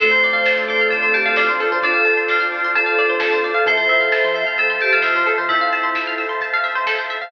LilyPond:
<<
  \new Staff \with { instrumentName = "Tubular Bells" } { \time 4/4 \key d \minor \tempo 4 = 131 c''4. c''16 r16 a'8 g'16 a'16 f'4 | a'4 f'4 a'2 | c''4. c''16 r16 a'8 g'16 a'16 f'4 | e'4. r2 r8 | }
  \new Staff \with { instrumentName = "Flute" } { \time 4/4 \key d \minor a1 | f'1 | e''8 e''4. c''2 | e'2 r2 | }
  \new Staff \with { instrumentName = "Electric Piano 2" } { \time 4/4 \key d \minor <c' d' f' a'>1 | <c' d' f' a'>1 | <c' e' f' a'>1 | <c' e' f' a'>1 | }
  \new Staff \with { instrumentName = "Pizzicato Strings" } { \time 4/4 \key d \minor a'16 c''16 d''16 f''16 a''16 c'''16 d'''16 f'''16 d'''16 c'''16 a''16 f''16 d''16 c''16 a'16 c''16 | d''16 f''16 a''16 c'''16 d'''16 f'''16 d'''16 c'''16 a''16 f''16 d''16 c''16 a'16 c''16 d''16 f''16 | a'16 c''16 e''16 f''16 a''16 c'''16 e'''16 f'''16 e'''16 c'''16 a''16 f''16 e''16 c''16 a'16 c''16 | e''16 f''16 a''16 c'''16 e'''16 f'''16 e'''16 c'''16 a''16 f''16 e''16 c''16 a'16 c''16 e''16 f''16 | }
  \new Staff \with { instrumentName = "Synth Bass 1" } { \clef bass \time 4/4 \key d \minor d,8 d,8. d,8. a,8. d,16 d,8. d,16~ | d,1 | f,8 f,8. f8. f,8. f,16 f,8. f,16~ | f,1 | }
  \new Staff \with { instrumentName = "Pad 5 (bowed)" } { \time 4/4 \key d \minor <c'' d'' f'' a''>1~ | <c'' d'' f'' a''>1 | <c'' e'' f'' a''>1~ | <c'' e'' f'' a''>1 | }
  \new DrumStaff \with { instrumentName = "Drums" } \drummode { \time 4/4 <cymc bd>16 hh16 hho16 hh16 <bd sn>16 hh16 hho16 hh16 <hh bd>16 hh16 hho16 hh16 <bd sn>16 hh16 hho16 hh16 | <hh bd>16 hh16 hho16 hh16 <bd sn>16 hh16 hho16 hh16 <hh bd>16 hh16 hho16 hh16 <bd sn>16 hh16 hho16 hh16 | <hh bd>16 hh16 hho16 hh16 <bd sn>16 hh16 hho16 hh16 <hh bd>16 hh16 hho16 hh16 <bd sn>16 hh16 hho16 hh16 | <hh bd>16 hh16 hho16 hh16 <bd sn>16 hh16 hho16 hh16 <hh bd>16 hh16 hho16 hh16 <bd sn>16 hh16 hho16 hh16 | }
>>